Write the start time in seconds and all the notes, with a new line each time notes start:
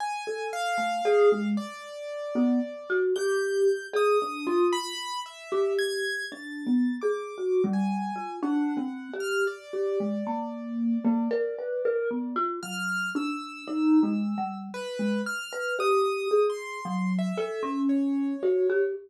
0.00 G#5
0.27 A4
0.53 F5
0.78 A3
1.05 G#4
1.32 G#3
1.57 D5
2.35 B3
2.90 F#4
3.16 G4 G6
3.93 G#4 D#6
4.22 D4
4.47 F4
4.73 B5
5.26 E5
5.52 G4
5.79 G#6
6.32 D4 A6
6.66 B3
7.02 G#4 D6
7.38 F#4
7.64 G3
7.73 G#5
8.16 F4
8.43 D4 F#5
8.77 C4
9.14 G4
9.20 F6
9.47 D5
9.73 G4
10.00 G#3
10.27 A#3
11.05 A#3
11.31 A#4
11.59 B4
11.85 A#4
12.11 B3
12.36 F4
12.63 F#3 F6
13.15 D4 E6
13.68 D#4
14.03 G#3
14.38 G3
14.74 B4
14.99 G#3
15.26 F6
15.53 B4
15.79 G4 D#6
16.31 G#4
16.50 C6
16.85 F#3
17.19 E5
17.38 A4
17.63 C#4
17.89 C#5
18.43 F#4
18.70 G4